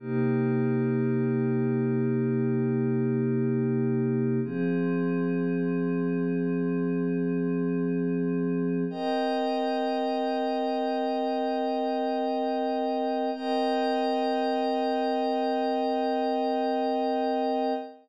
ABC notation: X:1
M:4/4
L:1/8
Q:1/4=108
K:Cm
V:1 name="Pad 5 (bowed)"
[C,B,EG]8- | [C,B,EG]8 | [F,CA]8- | [F,CA]8 |
[CBeg]8- | [CBeg]8 | [CBeg]8- | [CBeg]8 |]